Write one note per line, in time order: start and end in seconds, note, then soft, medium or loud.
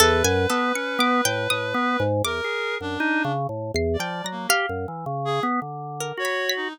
0.00 0.23 E2 loud
0.00 0.23 A4 loud
0.00 2.02 B4 loud
0.24 0.47 F#2 loud
0.24 0.47 G#5 medium
0.50 0.72 B3 loud
0.50 0.72 A4 medium
0.75 0.98 C#4 medium
0.75 0.98 C#7 medium
0.99 1.21 B3 loud
0.99 1.23 D6 medium
1.25 1.48 A2 medium
1.25 1.48 G5 loud
1.50 1.73 A2 medium
1.50 2.18 D#6 medium
1.74 1.97 B3 loud
2.00 2.22 G#2 loud
2.24 2.41 E2 medium
2.24 2.75 A#4 loud
2.24 3.60 D6 loud
2.44 2.78 G#4 medium
2.81 2.98 F#2 medium
2.81 3.32 D4 loud
3.00 3.23 D#4 loud
3.25 3.47 C#3 medium
3.49 3.72 A2 medium
3.74 3.97 E2 loud
3.74 3.98 C7 medium
3.94 4.27 D5 medium
3.99 4.22 F3 medium
3.99 4.23 G5 medium
4.24 4.47 F#3 medium
4.24 4.48 A#6 medium
4.31 4.48 A#3 medium
4.49 4.66 G4 medium
4.49 5.85 F5 loud
4.69 4.86 F#2 medium
4.88 5.05 E3 medium
5.06 5.40 C#3 medium
5.25 5.42 G#4 loud
5.43 5.60 B3 loud
5.62 6.12 D3 medium
6.00 6.23 A#4 medium
6.18 6.68 F#4 medium
6.18 6.53 C#5 loud
6.25 6.47 B5 medium
6.49 6.72 B6 loud
6.56 6.73 D#4 medium